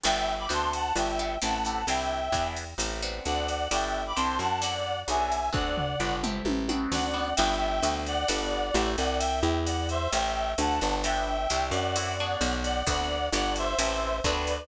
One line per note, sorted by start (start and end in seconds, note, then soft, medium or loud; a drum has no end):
0.04 0.47 G1 medium
0.04 0.36 B3 loud
0.04 0.36 D4 loud
0.04 0.36 F#4 loud
0.04 0.36 G4 loud
0.04 0.33 E5 loud
0.04 0.33 G5 loud
0.04 crash loud
0.04 ride medium
0.39 0.50 B5 medium
0.39 0.50 D6 medium
0.49 0.92 D2 medium
0.49 0.81 B3 loud
0.49 0.81 C4 loud
0.49 0.81 D4 loud
0.49 0.81 F#4 loud
0.49 hi-hat pedal medium
0.49 ride medium
0.53 0.72 A5 medium
0.53 0.72 C6 medium
0.73 0.97 F#5 medium
0.73 0.97 A5 medium
0.73 ride medium
0.96 1.38 G1 medium
0.96 1.12 B3 loud
0.96 1.12 D4 loud
0.96 1.12 F#4 loud
0.96 1.12 G4 loud
0.96 1.37 E5 medium
0.96 1.37 G5 medium
0.96 ride medium
1.19 1.35 B3 medium
1.19 1.35 D4 medium
1.19 1.35 F#4 medium
1.19 1.35 G4 medium
1.42 1.85 A1 medium
1.42 1.58 A3 loud
1.42 1.58 C4 loud
1.42 1.58 E4 loud
1.42 1.58 G4 loud
1.42 1.87 F#5 medium
1.42 1.87 A5 medium
1.42 hi-hat pedal medium
1.42 ride medium
1.65 1.82 A3 medium
1.65 1.82 C4 medium
1.65 1.82 E4 medium
1.65 1.82 G4 medium
1.65 ride medium
1.87 2.29 C2 medium
1.87 2.21 C4 loud
1.87 2.21 D4 loud
1.87 2.21 E4 loud
1.87 2.21 G4 medium
1.87 2.47 E5 medium
1.87 2.47 G5 medium
1.87 ride medium
2.32 2.74 E2 medium
2.32 2.65 B3 loud
2.32 2.65 D4 loud
2.32 2.65 E4 loud
2.32 2.65 G#4 loud
2.32 kick soft
2.32 hi-hat pedal medium
2.32 ride medium
2.56 ride medium
2.78 3.20 A1 medium
2.78 3.02 C4 medium
2.78 3.02 E4 loud
2.78 3.02 G4 loud
2.78 3.02 A4 loud
2.78 ride medium
3.02 3.57 B3 loud
3.02 3.57 C4 loud
3.02 3.57 D4 loud
3.02 3.57 F#4 loud
3.25 3.68 D2 medium
3.25 3.68 D5 medium
3.25 3.68 F#5 medium
3.25 hi-hat pedal medium
3.25 ride medium
3.48 ride medium
3.71 4.13 G1 medium
3.71 4.03 B3 medium
3.71 4.03 D4 loud
3.71 4.03 F#4 loud
3.71 4.03 G4 loud
3.71 4.03 E5 medium
3.71 4.03 G5 medium
3.71 ride medium
4.07 4.18 B5 medium
4.07 4.18 D6 medium
4.16 4.39 C2 medium
4.16 4.49 C4 loud
4.16 4.49 D4 loud
4.16 4.49 E4 loud
4.16 4.49 G4 loud
4.16 4.38 A5 medium
4.16 4.38 C6 medium
4.16 hi-hat pedal medium
4.16 ride medium
4.39 5.04 F#2 medium
4.39 4.59 F#5 medium
4.39 4.59 A5 medium
4.39 ride medium
4.61 4.94 C4 loud
4.61 4.94 E4 loud
4.61 4.94 F#4 loud
4.61 4.94 A4 loud
4.61 5.00 D5 medium
4.61 5.00 F#5 medium
4.61 ride medium
5.08 5.50 B1 medium
5.08 5.40 B3 loud
5.08 5.40 D4 loud
5.08 5.40 F#4 loud
5.08 5.40 G#4 loud
5.08 5.50 E5 medium
5.08 5.50 G#5 medium
5.08 hi-hat pedal medium
5.08 ride medium
5.32 ride medium
5.53 5.96 D2 medium
5.53 5.85 B3 loud
5.53 5.85 C4 loud
5.53 5.85 D4 loud
5.53 5.85 F#4 loud
5.53 6.14 D5 medium
5.53 6.14 F#5 medium
5.53 kick medium
5.78 floor tom medium
6.00 6.42 G1 medium
6.00 6.22 B3 loud
6.00 6.22 D4 loud
6.00 6.22 F#4 loud
6.00 6.22 G4 loud
6.23 6.63 A3 loud
6.23 6.63 C4 loud
6.23 6.63 E4 loud
6.23 6.63 G4 medium
6.23 mid tom medium
6.45 6.87 A1 medium
6.45 high tom medium
6.69 7.08 B3 medium
6.69 7.08 C4 loud
6.69 7.08 D4 loud
6.69 7.08 F#4 loud
6.69 high tom medium
6.92 7.34 D2 medium
6.92 7.34 D5 medium
6.92 7.34 F#5 medium
6.92 snare medium
7.14 7.30 B3 loud
7.14 7.30 C4 medium
7.14 7.30 D4 medium
7.14 7.30 F#4 medium
7.36 7.81 G1 loud
7.36 7.71 B3 loud
7.36 7.71 D4 loud
7.36 7.71 F#4 loud
7.36 7.71 G4 loud
7.36 7.93 E5 loud
7.36 7.93 G5 loud
7.36 crash medium
7.36 ride medium
7.83 8.25 D2 loud
7.83 8.15 B3 loud
7.83 8.15 C4 loud
7.83 8.15 D4 loud
7.83 8.15 F#4 loud
7.83 hi-hat pedal medium
7.83 ride medium
8.06 8.90 D5 medium
8.06 8.90 F#5 loud
8.06 ride medium
8.28 8.71 G1 medium
8.28 8.60 B3 loud
8.28 8.60 D4 loud
8.28 8.60 F#4 loud
8.28 8.60 G4 loud
8.28 ride medium
8.74 8.96 A1 loud
8.74 9.08 A3 loud
8.74 9.08 C4 loud
8.74 9.08 E4 loud
8.74 9.08 G4 loud
8.74 hi-hat pedal medium
8.74 ride medium
8.97 9.42 C2 loud
8.97 9.18 D5 medium
8.97 9.18 F#5 loud
8.97 ride medium
9.19 9.58 E5 medium
9.19 9.58 G5 loud
9.19 ride medium
9.43 10.08 E2 loud
9.65 9.87 D5 medium
9.65 9.87 F#5 medium
9.65 hi-hat pedal medium
9.65 ride medium
9.89 10.10 C5 medium
9.89 10.10 E5 medium
9.89 ride medium
10.12 10.55 A1 loud
10.12 10.52 E5 medium
10.12 10.52 G5 loud
10.12 ride medium
10.58 10.80 D2 loud
10.58 10.97 F#5 medium
10.58 10.97 A5 medium
10.58 hi-hat pedal medium
10.58 ride medium
10.81 11.47 G1 loud
10.81 ride medium
11.03 11.37 B3 loud
11.03 11.37 D4 loud
11.03 11.37 F#4 loud
11.03 11.37 G4 loud
11.03 11.64 E5 medium
11.03 11.64 G5 loud
11.03 ride medium
11.50 11.72 C2 loud
11.50 11.82 C4 loud
11.50 11.82 D4 loud
11.50 11.82 E4 loud
11.50 11.82 G4 loud
11.50 hi-hat pedal medium
11.50 ride medium
11.71 12.36 F#2 loud
11.71 12.53 D5 medium
11.71 12.53 F#5 medium
11.71 ride medium
11.96 12.18 C4 loud
11.96 12.18 E4 loud
11.96 12.18 F#4 loud
11.96 12.18 A4 loud
11.96 ride medium
12.20 12.75 B3 loud
12.20 12.75 D4 loud
12.20 12.75 F#4 loud
12.20 12.75 G#4 loud
12.41 12.83 B1 loud
12.41 hi-hat pedal medium
12.41 ride medium
12.63 12.84 D5 medium
12.63 12.84 F#5 medium
12.63 ride medium
12.87 13.29 D2 loud
12.87 13.19 B3 loud
12.87 13.19 C4 loud
12.87 13.19 D4 loud
12.87 13.19 F#4 loud
12.87 13.28 D5 medium
12.87 13.28 F#5 loud
12.87 kick medium
12.87 ride medium
13.32 13.75 G1 loud
13.32 13.66 B3 loud
13.32 13.66 D4 loud
13.32 13.66 F#4 loud
13.32 13.66 G4 loud
13.32 13.54 D5 medium
13.32 13.54 F#5 loud
13.32 hi-hat pedal medium
13.32 ride medium
13.56 13.79 C5 medium
13.56 13.79 E5 loud
13.56 ride medium
13.79 14.21 A1 loud
13.79 14.11 A3 loud
13.79 14.11 C4 loud
13.79 14.11 E4 loud
13.79 14.11 G4 loud
13.79 14.17 C5 medium
13.79 14.17 E5 medium
13.79 ride loud
14.24 14.66 D2 loud
14.24 14.58 B3 loud
14.24 14.58 C4 loud
14.24 14.58 D4 loud
14.24 14.58 F#4 loud
14.24 14.65 B4 medium
14.24 14.65 D5 medium
14.24 kick medium
14.24 hi-hat pedal medium
14.24 ride medium
14.47 ride medium